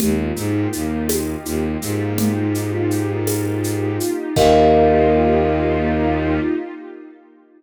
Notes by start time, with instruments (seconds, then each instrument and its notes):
0.00 violin D#2, pad 2 (warm) A#3 D#4 F4 G4, kalimba G4, low conga, shaker
0.36 violin G#2, kalimba G#3, shaker
0.73 violin D#2, kalimba D#4, shaker
1.09 tambourine, high conga, shaker
1.45 violin D#2, kalimba D#4, shaker
1.82 violin G#2, kalimba G#3, shaker
2.18 low conga, shaker
2.55 shaker
2.91 shaker
3.27 tambourine, high conga, shaker
3.64 shaker
4.00 shaker
4.36 violin D#2, pad 2 (warm) A#3 D#4 F4 G4, kalimba G4 A#4 D#5 F5, kick, crash